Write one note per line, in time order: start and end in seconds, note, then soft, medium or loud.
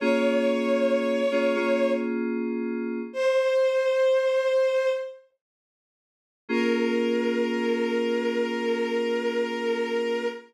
0.00 1.21 A#3 loud
0.00 1.21 C#4 loud
0.00 1.21 F4 loud
0.00 1.21 G#4 loud
0.00 1.90 C#5 loud
1.31 1.55 A#3 medium
1.31 1.55 C#4 medium
1.31 1.55 F4 medium
1.31 1.55 G#4 loud
1.56 3.00 A#3 medium
1.56 3.00 C#4 medium
1.56 3.00 F4 loud
1.56 3.00 G#4 medium
3.13 4.89 C5 loud
6.49 10.25 A#3 loud
6.49 10.25 C#4 medium
6.49 10.25 F4 loud
6.49 10.25 G#4 loud
6.49 10.26 A#4 loud